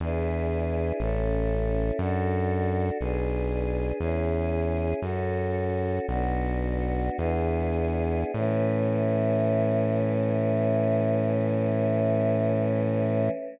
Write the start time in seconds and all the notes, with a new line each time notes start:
0.00 E2 D4 E4 G#4 B4
1.00 A1 C#4 E4 A4
1.99 F#2 D4 F#4 A4
3.00 B1 D4 G#4 B4
3.99 E2 C#4 E4 G#4
5.01 F#2 C#4 F#4 A4
6.08 B1 B3 D4 F#4
7.17 E2 B3 D4 E4 G#4
8.34 A2 E3 A3 C#4